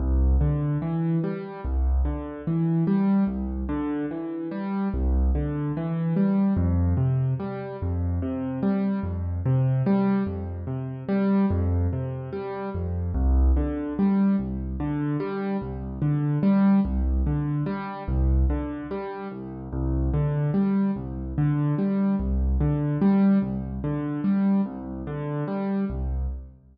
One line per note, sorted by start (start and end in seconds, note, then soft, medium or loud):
0.00 0.36 C2 medium
0.41 0.78 D3 medium
0.82 1.19 E3 medium
1.24 1.61 G3 medium
1.65 2.02 C2 medium
2.05 2.42 D3 medium
2.47 2.84 E3 medium
2.87 3.24 G3 medium
3.27 3.64 C2 medium
3.69 4.06 D3 medium
4.11 4.48 E3 medium
4.51 4.88 G3 medium
4.94 5.31 C2 medium
5.35 5.72 D3 medium
5.77 6.14 E3 medium
6.16 6.53 G3 medium
6.57 6.94 F2 medium
6.97 7.34 C3 medium
7.40 7.77 G3 medium
7.82 8.19 F2 medium
8.22 8.59 C3 medium
8.63 9.00 G3 medium
9.03 9.40 F2 medium
9.46 9.83 C3 medium
9.86 10.23 G3 medium
10.27 10.64 F2 medium
10.67 11.04 C3 medium
11.09 11.46 G3 medium
11.51 11.88 F2 medium
11.93 12.30 C3 medium
12.33 12.70 G3 medium
12.74 13.11 F2 medium
13.14 13.51 C2 medium
13.57 13.93 D3 medium
13.99 14.36 G3 medium
14.39 14.76 C2 medium
14.80 15.17 D3 medium
15.20 15.57 G3 medium
15.61 15.98 C2 medium
16.02 16.39 D3 medium
16.43 16.80 G3 medium
16.85 17.22 C2 medium
17.27 17.64 D3 medium
17.66 18.03 G3 medium
18.08 18.45 C2 medium
18.50 18.87 D3 medium
18.91 19.28 G3 medium
19.32 19.68 C2 medium
19.73 20.10 C2 medium
20.14 20.51 D3 medium
20.54 20.91 G3 medium
20.96 21.33 C2 medium
21.38 21.75 D3 medium
21.78 22.15 G3 medium
22.20 22.57 C2 medium
22.60 22.97 D3 medium
23.02 23.39 G3 medium
23.42 23.79 C2 medium
23.84 24.21 D3 medium
24.24 24.61 G3 medium
24.66 25.03 C2 medium
25.07 25.44 D3 medium
25.48 25.85 G3 medium
25.90 26.27 C2 medium